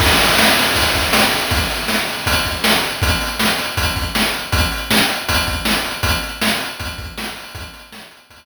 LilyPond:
\new DrumStaff \drummode { \time 4/4 \tempo 4 = 159 <cymc bd>8 hh8 sn8 hh8 <hh bd>8 <hh bd>8 sn8 hh8 | <hh bd>8 hh8 sn8 hh8 <hh bd>8 <hh bd>8 sn8 hh8 | <hh bd>8 hh8 sn8 hh8 <hh bd>8 <hh bd>8 sn8 hh8 | <hh bd>8 hh8 sn8 hh8 <hh bd>8 <hh bd>8 sn8 hh8 |
<hh bd>8 hh8 sn8 hh8 <hh bd>8 <hh bd>8 sn8 hho8 | <hh bd>8 hh8 sn8 hh8 <hh bd>4 r4 | }